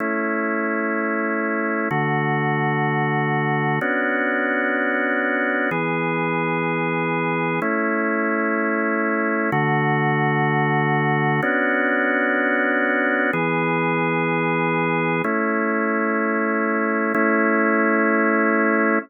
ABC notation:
X:1
M:6/8
L:1/8
Q:3/8=63
K:A
V:1 name="Drawbar Organ"
[A,CE]6 | [D,A,F]6 | [B,CDF]6 | [E,B,G]6 |
[A,CE]6 | [D,A,F]6 | [B,CDF]6 | [E,B,G]6 |
[A,CE]6 | [A,CE]6 |]